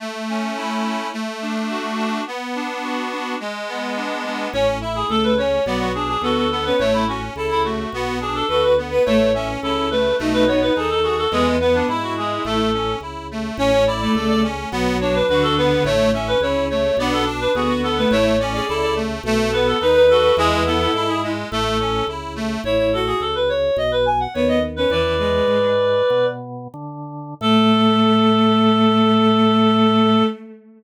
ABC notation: X:1
M:4/4
L:1/16
Q:1/4=106
K:A
V:1 name="Clarinet"
z16 | z16 | c z e G A B c2 d F G G A A A B | c E F z2 E F4 G A A B z2 |
c2 e z A2 B2 z B c B G A G A | G z B D E F G2 A4 z4 | c c d d2 d z4 c B B A B2 | c2 e B c2 c2 d A z B G F A B |
c c d d2 d z4 B A B B A2 | G G A A2 G z2 A4 z4 | c c A G A B c2 ^d B g f c d z B | "^rit." [Bd]10 z6 |
A16 |]
V:2 name="Violin"
z16 | z16 | z4 A,2 z2 F,2 z2 B,2 z C | z4 A2 z2 F2 z2 B2 z B |
A, z2 C C2 z2 ^D4 A4 | B,2 B,2 E6 z6 | C z2 A, A,2 z2 F,4 D,4 | z4 C2 z2 D2 z2 B,2 z A, |
E z2 G A2 z2 A4 B4 | E8 z8 | E2 F2 z8 B,2 z C | "^rit." E,2 G,4 z10 |
A,16 |]
V:3 name="Accordion"
A,2 C2 E2 C2 A,2 D2 F2 D2 | B,2 D2 F2 D2 G,2 B,2 D2 B,2 | C2 E2 A2 C2 B,2 D2 F2 B,2 | A,2 C2 E2 A,2 B,2 D2 F2 B,2 |
A,2 C2 E2 A,2 A,2 B,2 ^D2 F2 | G,2 B,2 E2 G,2 A,2 C2 E2 A,2 | C2 E2 A2 C2 B,2 D2 F2 B,2 | A,2 C2 E2 A,2 B,2 D2 F2 B,2 |
A,2 C2 E2 A,2 A,2 B,2 ^D2 F2 | G,2 B,2 E2 G,2 A,2 C2 E2 A,2 | z16 | "^rit." z16 |
z16 |]
V:4 name="Drawbar Organ" clef=bass
z16 | z16 | A,,,4 C,,4 B,,,4 D,,4 | A,,,4 C,,4 B,,,4 D,,4 |
A,,,4 C,,4 B,,,4 ^D,,4 | E,,4 G,,4 A,,,4 C,,4 | A,,,4 C,,4 B,,,4 D,,4 | A,,,4 C,,4 B,,,4 D,,4 |
A,,,4 C,,4 B,,,4 ^D,,4 | E,,4 G,,4 A,,,4 C,,4 | A,,,4 C,,4 B,,,4 ^D,,4 | "^rit." E,,4 G,,4 B,,4 D,4 |
A,,16 |]